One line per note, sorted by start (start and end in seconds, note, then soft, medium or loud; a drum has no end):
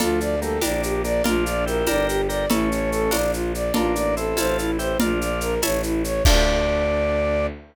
0.00 0.57 D2 medium
0.00 0.36 F3 medium
0.00 0.36 A3 medium
0.00 0.56 D4 medium
0.00 0.56 F4 medium
0.00 0.19 F4 medium
0.00 0.56 A4 loud
0.00 cowbell medium
0.00 low conga medium
0.00 shaker medium
0.20 0.40 D5 medium
0.20 shaker medium
0.42 0.59 G3 medium
0.42 0.59 A#3 medium
0.42 0.61 A4 medium
0.42 shaker medium
0.61 1.20 A#1 medium
0.61 1.02 A#3 medium
0.61 1.18 D4 loud
0.61 1.02 D4 medium
0.61 1.18 G4 medium
0.61 1.18 A#4 loud
0.61 0.82 D5 medium
0.61 tambourine medium
0.61 cowbell medium
0.61 high conga medium
0.61 shaker medium
0.83 1.03 G4 medium
0.83 shaker medium
1.04 1.22 A#3 medium
1.04 1.22 D4 medium
1.04 1.23 D5 medium
1.04 shaker medium
1.24 1.82 A#1 medium
1.24 1.80 D4 loud
1.24 1.65 D4 medium
1.24 1.80 F4 medium
1.24 1.65 F4 medium
1.24 1.44 F4 loud
1.24 1.80 A#4 medium
1.24 cowbell medium
1.24 low conga medium
1.24 shaker medium
1.46 1.65 D5 medium
1.46 shaker medium
1.66 1.86 E4 medium
1.66 1.86 G4 medium
1.66 1.86 A#4 medium
1.66 shaker medium
1.87 2.45 G1 medium
1.87 2.43 D4 medium
1.87 2.43 G4 medium
1.87 2.22 G4 medium
1.87 2.43 A#4 loud
1.87 2.22 A#4 medium
1.87 2.07 D5 medium
1.87 tambourine medium
1.87 cowbell medium
1.87 high conga medium
1.87 shaker medium
2.08 2.28 G4 medium
2.08 shaker medium
2.29 2.46 G4 medium
2.29 2.46 A#4 medium
2.29 2.48 D5 medium
2.29 shaker medium
2.50 3.08 A1 medium
2.50 3.17 A3 medium
2.50 3.06 C#4 medium
2.50 3.17 C#4 medium
2.50 3.06 E4 medium
2.50 2.69 E4 medium
2.50 3.06 A4 loud
2.50 cowbell medium
2.50 low conga loud
2.50 shaker medium
2.71 2.90 C#5 medium
2.71 shaker medium
2.92 3.11 A4 medium
2.92 shaker medium
3.11 3.70 A#1 medium
3.11 3.67 D4 loud
3.11 3.67 F4 medium
3.11 3.67 A#4 loud
3.11 3.32 D5 medium
3.11 tambourine medium
3.11 cowbell medium
3.11 high conga medium
3.11 shaker medium
3.33 3.52 F4 medium
3.33 shaker medium
3.54 3.73 D5 medium
3.54 shaker medium
3.74 4.33 A1 medium
3.74 4.15 A#3 medium
3.74 4.30 D4 medium
3.74 4.15 D4 medium
3.74 4.30 F4 medium
3.74 3.94 F4 medium
3.74 4.30 A4 medium
3.74 cowbell medium
3.74 low conga medium
3.74 shaker medium
3.95 4.15 D5 medium
3.95 shaker medium
4.17 4.37 C4 medium
4.17 4.37 E4 medium
4.17 4.36 A4 medium
4.17 shaker medium
4.37 4.95 A1 medium
4.37 4.93 C4 medium
4.37 4.93 E4 loud
4.37 4.71 F4 medium
4.37 4.93 A4 medium
4.37 4.71 A4 medium
4.37 4.57 C5 medium
4.37 tambourine medium
4.37 cowbell medium
4.37 high conga medium
4.37 shaker medium
4.59 4.78 E4 medium
4.59 shaker medium
4.79 4.98 E4 medium
4.79 4.98 G4 medium
4.79 4.98 C5 medium
4.79 shaker medium
5.00 5.57 A#1 medium
5.00 5.55 D4 medium
5.00 5.19 F4 medium
5.00 5.55 F4 medium
5.00 5.57 D5 medium
5.00 5.57 F5 loud
5.00 5.57 A#5 loud
5.00 cowbell medium
5.00 low conga loud
5.00 shaker medium
5.21 5.40 D5 medium
5.21 shaker medium
5.41 5.61 A#4 medium
5.41 shaker medium
5.62 6.20 A1 medium
5.62 5.82 C#5 medium
5.62 6.19 C#5 medium
5.62 6.19 E5 loud
5.62 6.19 A5 loud
5.62 tambourine medium
5.62 cowbell medium
5.62 high conga medium
5.62 shaker medium
5.83 6.03 E4 medium
5.83 shaker medium
6.04 6.23 C#5 medium
6.04 shaker medium
6.25 7.47 D2 loud
6.25 7.47 D4 loud
6.25 7.48 D4 loud
6.25 7.48 F4 loud
6.25 7.48 A4 loud
6.25 7.46 D5 loud
6.25 kick loud
6.25 crash loud